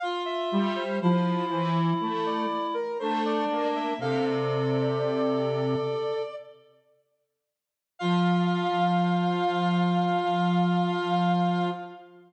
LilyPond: <<
  \new Staff \with { instrumentName = "Ocarina" } { \time 4/4 \key f \major \tempo 4 = 60 f''16 e''8 c''16 c''8. r8 d''8 bes'16 c''16 d''8 e''16 | f''16 d''2~ d''16 r4. | f''1 | }
  \new Staff \with { instrumentName = "Clarinet" } { \time 4/4 \key f \major f'4 e'2 d'4 | a'2~ a'8 r4. | f'1 | }
  \new Staff \with { instrumentName = "Lead 1 (square)" } { \time 4/4 \key f \major r8 g8 f8 e8 a8 r8 a8 bes8 | c2 r2 | f1 | }
>>